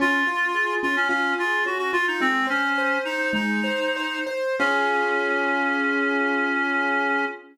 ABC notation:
X:1
M:4/4
L:1/16
Q:1/4=109
K:Db
V:1 name="Clarinet"
F6 F D D2 F2 G G F E | "^rit." C2 D4 E2 E6 z2 | D16 |]
V:2 name="Acoustic Grand Piano"
D2 F2 A2 D2 F2 A2 D2 F2 | "^rit." A,2 c2 c2 c2 A,2 c2 c2 c2 | [DFA]16 |]